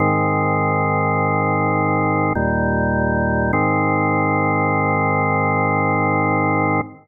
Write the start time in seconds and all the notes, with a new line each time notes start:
0.00 G#2 D#3 C4
2.35 D#2 A#2 G3
3.53 G#2 D#3 C4